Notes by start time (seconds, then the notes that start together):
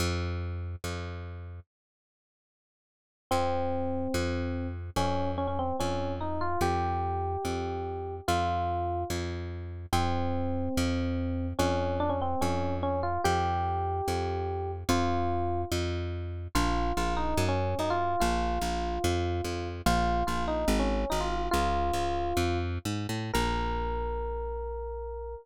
0.00 F2
0.84 F2
3.31 F2 C4
4.14 F2
4.96 F2 C#4
5.38 C#4
5.47 C#4
5.59 C4
5.80 F2 C#4
6.21 D#4
6.41 F4
6.61 F2 G4
7.45 F2
8.28 F2 F4
9.10 F2
9.93 F2 C4
10.77 F2
11.59 F2 C#4
12.00 D4
12.09 C#4
12.21 C4
12.41 F2 C#4
12.83 C#4
13.03 F4
13.24 F2 G4
14.08 F2
14.89 F2 F4
15.72 F2
16.55 A#1 F4
16.97 A#1 F4
17.17 D#4
17.37 F#2
17.49 C#4
17.79 F#2 D#4
17.90 F4
18.20 A#1 F4
18.61 A#1
19.04 F2
19.44 F2
19.86 A#1 F4
20.27 A#1 F4
20.48 D#4
20.68 G#1
20.79 C#4
21.10 G#1 D#4
21.21 F4
21.51 C#2 F4
21.93 C#2
22.37 F2
22.85 G#2
23.09 A2
23.34 A#1 A#4